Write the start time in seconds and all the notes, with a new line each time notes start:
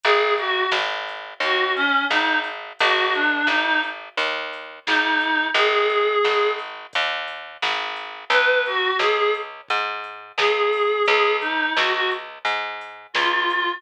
0.03 G#1 G#4, kick, closed hi-hat
0.38 F#4, kick, closed hi-hat
0.71 G#1, snare
1.08 closed hi-hat
1.40 D#2 F#4, kick, closed hi-hat
1.76 C#4, closed hi-hat
2.10 G#1 D#4, snare
2.44 closed hi-hat
2.79 G#1 F#4, kick, closed hi-hat
3.14 D4, kick, closed hi-hat
3.47 G#1 D#4, snare
3.65 D#4
3.83 closed hi-hat
4.17 D#2, kick, closed hi-hat
4.53 closed hi-hat
4.86 G#1 D#4, snare
5.21 closed hi-hat
5.54 G#1 G#4, kick, closed hi-hat
5.90 kick, closed hi-hat
6.24 G#1, snare
6.59 closed hi-hat
6.93 D#2, kick, closed hi-hat
7.28 closed hi-hat
7.62 G#1, snare
7.96 closed hi-hat
8.30 C#2 B4, kick, closed hi-hat
8.66 F#4, closed hi-hat
8.99 C#2 G#4, snare
9.17 G#4
9.34 closed hi-hat
9.68 G#2, kick, closed hi-hat
10.04 closed hi-hat
10.38 C#2 G#4, snare
10.73 open hi-hat
11.06 C#2 G#4, kick, closed hi-hat
11.41 D#4, kick, closed hi-hat
11.76 C#2 F#4, snare
11.93 F#4
12.11 closed hi-hat
12.45 G#2, kick, closed hi-hat
12.81 closed hi-hat
13.14 C#2 F4, snare
13.50 closed hi-hat